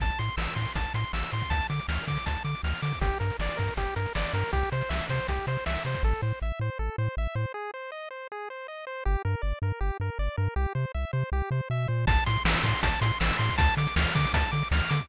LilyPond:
<<
  \new Staff \with { instrumentName = "Lead 1 (square)" } { \time 4/4 \key f \major \tempo 4 = 159 a''8 c'''8 e'''8 c'''8 a''8 c'''8 e'''8 c'''8 | a''8 d'''8 f'''8 d'''8 a''8 d'''8 f'''8 d'''8 | g'8 bes'8 d''8 bes'8 g'8 bes'8 d''8 bes'8 | g'8 c''8 e''8 c''8 g'8 c''8 e''8 c''8 |
a'8 c''8 e''8 c''8 a'8 c''8 e''8 c''8 | aes'8 c''8 ees''8 c''8 aes'8 c''8 ees''8 c''8 | g'8 bes'8 d''8 bes'8 g'8 bes'8 d''8 bes'8 | g'8 c''8 e''8 c''8 g'8 c''8 e''8 c''8 |
a''8 c'''8 e'''8 c'''8 a''8 c'''8 e'''8 c'''8 | a''8 d'''8 f'''8 d'''8 a''8 d'''8 f'''8 d'''8 | }
  \new Staff \with { instrumentName = "Synth Bass 1" } { \clef bass \time 4/4 \key f \major a,,8 a,8 a,,8 a,8 a,,8 a,8 a,,8 a,8 | d,8 d8 d,8 d8 d,8 d8 d,8 d8 | g,,8 g,8 g,,8 g,8 g,,8 g,8 g,,8 g,8 | c,8 c8 c,8 c8 c,8 c8 c,8 c8 |
a,,8 a,8 a,,8 a,8 a,,8 a,8 a,,8 a,8 | r1 | g,,8 g,8 g,,8 g,8 g,,8 g,8 g,,8 g,8 | c,8 c8 c,8 c8 c,8 c8 b,8 bes,8 |
a,,8 a,8 a,,8 a,8 a,,8 a,8 a,,8 a,8 | d,8 d8 d,8 d8 d,8 d8 d,8 d8 | }
  \new DrumStaff \with { instrumentName = "Drums" } \drummode { \time 4/4 <hh bd>16 hh16 hh16 hh16 sn16 hh16 <hh bd>16 hh16 <hh bd>16 hh16 hh16 hh16 sn16 hh16 hh16 <hh bd>16 | <hh bd>16 hh16 hh16 hh16 sn16 hh16 <hh bd>16 hh16 <hh bd>16 hh16 hh16 hh16 sn16 hh16 hh16 <hh bd>16 | <hh bd>16 hh16 hh16 hh16 sn16 hh16 <hh bd>16 hh16 <hh bd>16 hh16 hh16 hh16 sn16 hh16 hh16 hh16 | <hh bd>16 hh16 hh16 hh16 sn16 hh16 <hh bd>16 hh16 <hh bd>16 hh16 hh16 hh16 sn16 hh16 hh16 <hh bd>16 |
r4 r4 r4 r4 | r4 r4 r4 r4 | r4 r4 r4 r4 | r4 r4 r4 r4 |
<hh bd>16 hh16 hh16 hh16 sn16 hh16 <hh bd>16 hh16 <hh bd>16 hh16 hh16 hh16 sn16 hh16 hh16 <hh bd>16 | <hh bd>16 hh16 hh16 hh16 sn16 hh16 <hh bd>16 hh16 <hh bd>16 hh16 hh16 hh16 sn16 hh16 hh16 <hh bd>16 | }
>>